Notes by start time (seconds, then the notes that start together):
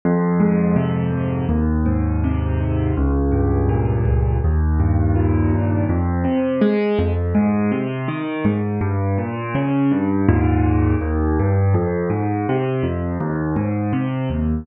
0.05 F2
0.40 G#2
0.76 C3
1.12 F2
1.49 D#2
1.86 G#2
2.24 C3
2.61 D#2
2.97 C#2
3.32 G2
3.69 A#2
4.05 C#2
4.44 D#2
4.79 G2
5.15 A#2
5.54 D#2
5.89 F2
6.24 C3
6.61 G#3
6.99 F2
7.35 G#2
7.72 C3
8.08 D#3
8.45 G#2
8.81 G2
9.18 A#2
9.55 C#3
9.91 G2
10.29 D#2 G#2 A#2
11.01 D#2
11.39 G2
11.74 F2
12.10 G#2
12.49 C3
12.83 F2
13.20 D#2
13.56 G#2
13.93 C3
14.30 D#2